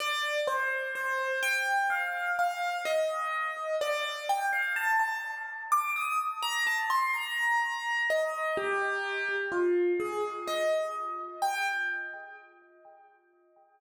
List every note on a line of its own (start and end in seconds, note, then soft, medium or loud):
0.00 0.40 D5 loud
0.47 0.87 C5 loud
0.95 1.39 C5 medium
1.43 1.87 G5 loud
1.90 2.32 F5 medium
2.39 2.78 F5 loud
2.85 3.75 D#5 loud
3.81 4.25 D5 loud
4.29 4.49 G5 loud
4.53 4.72 F5 medium
4.76 4.97 A5 loud
4.99 5.20 A5 medium
5.72 5.93 D6 loud
5.96 6.18 D#6 loud
6.42 6.64 A#5 loud
6.67 6.78 A5 loud
6.90 7.11 C6 loud
7.14 8.02 A#5 loud
8.10 8.57 D#5 loud
8.57 9.36 G4 loud
9.52 9.92 F4 medium
10.00 10.22 G#4 loud
10.48 10.93 D#5 medium
11.42 11.67 G5 loud